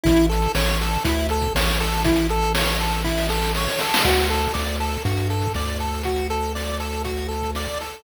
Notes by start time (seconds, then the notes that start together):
0.03 A1 E4, kick, closed hi-hat
0.16 closed hi-hat
0.29 A4, closed hi-hat
0.42 closed hi-hat
0.55 A1 C#5, snare
0.66 closed hi-hat
0.81 A4, closed hi-hat
0.93 closed hi-hat
1.04 D2 E4, kick, closed hi-hat
1.19 closed hi-hat
1.29 A4, closed hi-hat
1.42 kick, closed hi-hat
1.55 A1 C#5, snare
1.68 closed hi-hat
1.80 A4, closed hi-hat
1.92 open hi-hat
2.04 E4, kick, closed hi-hat
2.16 closed hi-hat
2.29 A4, closed hi-hat
2.42 closed hi-hat
2.55 C#5, snare
2.67 closed hi-hat
2.80 A4, closed hi-hat
2.91 closed hi-hat
3.04 E4, kick, snare
3.17 snare
3.29 A4, snare
3.42 snare
3.55 C#5, snare
3.68 snare
3.79 A4, snare
3.94 snare
4.04 D2 F#4, kick, crash
4.18 closed hi-hat
4.29 A4, closed hi-hat
4.43 closed hi-hat
4.54 D2 D5, snare
4.66 closed hi-hat
4.80 A4, closed hi-hat
4.92 closed hi-hat
5.05 G2 F#4, kick, closed hi-hat
5.17 closed hi-hat
5.30 A4, closed hi-hat
5.42 kick, closed hi-hat
5.54 D2 D5, snare
5.67 closed hi-hat
5.79 A4, closed hi-hat
5.94 closed hi-hat
6.03 F#4, kick, closed hi-hat
6.16 closed hi-hat
6.30 A4, closed hi-hat
6.43 closed hi-hat
6.55 D5, snare
6.67 closed hi-hat
6.80 A4, closed hi-hat
6.93 closed hi-hat
7.04 F#4, kick, closed hi-hat
7.17 closed hi-hat
7.28 A4, closed hi-hat
7.42 kick, closed hi-hat
7.55 D5, snare
7.68 closed hi-hat
7.81 A4, closed hi-hat
7.92 closed hi-hat